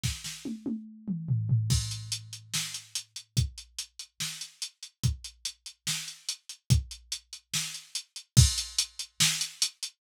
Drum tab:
CC |--------|x-------|--------|--------|
HH |--------|-xxx-xxx|xxxx-xxx|xxxx-xxx|
SD |oo------|----o---|----o---|----o---|
T1 |--oo----|--------|--------|--------|
T2 |-----o--|--------|--------|--------|
FT |------oo|--------|--------|--------|
BD |o-------|o-------|o-------|o-------|

CC |--------|x-------|
HH |xxxx-xxx|-xxx-xxx|
SD |----o---|----o---|
T1 |--------|--------|
T2 |--------|--------|
FT |--------|--------|
BD |o-------|o-------|